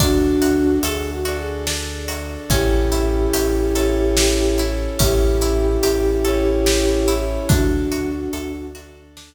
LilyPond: <<
  \new Staff \with { instrumentName = "Flute" } { \time 3/4 \key d \lydian \tempo 4 = 72 <d' fis'>4 \tuplet 3/2 { gis'8 fis'8 gis'8 } r4 | <e' g'>2. | <e' g'>2. | <d' fis'>4. r4. | }
  \new Staff \with { instrumentName = "Orchestral Harp" } { \time 3/4 \key d \lydian d'8 fis'8 a'8 fis'8 d'8 fis'8 | cis'8 e'8 g'8 a'8 g'8 e'8 | cis'8 e'8 g'8 a'8 g'8 e'8 | d'8 fis'8 a'8 fis'8 d'8 r8 | }
  \new Staff \with { instrumentName = "Synth Bass 2" } { \clef bass \time 3/4 \key d \lydian d,4 d,2 | a,,4 a,,2 | a,,4 a,,2 | d,4 d,2 | }
  \new Staff \with { instrumentName = "Brass Section" } { \time 3/4 \key d \lydian <d' fis' a'>4. <d' a' d''>4. | <cis' e' g' a'>4. <cis' e' a' cis''>4. | <cis' e' g' a'>4. <cis' e' a' cis''>4. | <d' fis' a'>4. <d' a' d''>4. | }
  \new DrumStaff \with { instrumentName = "Drums" } \drummode { \time 3/4 <hh bd>8 hh8 hh8 hh8 sn8 hh8 | <hh bd>8 hh8 hh8 hh8 sn8 hh8 | <hh bd>8 hh8 hh8 hh8 sn8 hh8 | <hh bd>8 hh8 hh8 hh8 sn4 | }
>>